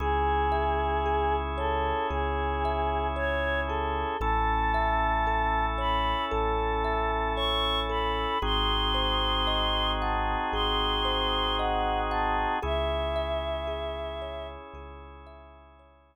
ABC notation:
X:1
M:4/4
L:1/8
Q:1/4=57
K:C#m
V:1 name="Choir Aahs"
G3 A G2 c A | a3 b a2 c' b | ^b3 a b2 f a | e4 z4 |]
V:2 name="Kalimba"
G e G c G e c G | A e A c A e c A | G ^B d f G B d f | G e G c G e c z |]
V:3 name="Synth Bass 2" clef=bass
C,,4 C,,4 | A,,,4 A,,,4 | G,,,4 G,,,4 | C,,4 C,,4 |]
V:4 name="Drawbar Organ"
[CEG]8 | [CEA]8 | [^B,DFG]8 | [CEG]8 |]